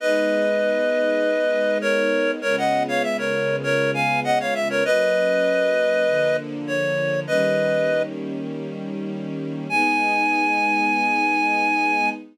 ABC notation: X:1
M:4/4
L:1/16
Q:1/4=99
K:G#m
V:1 name="Clarinet"
[Bd]12 [Ac]4 | [Ac] [df]2 [c^e] =e [Ac]3 [Ac]2 [^eg]2 [df] [ce] =e [Ac] | [Bd]12 c4 | [Bd]6 z10 |
g16 |]
V:2 name="String Ensemble 1"
[G,B,D]16 | [C,G,B,^E]16 | [F,A,C]8 [=D,^E,A,]8 | [D,=G,A,C]16 |
[G,B,D]16 |]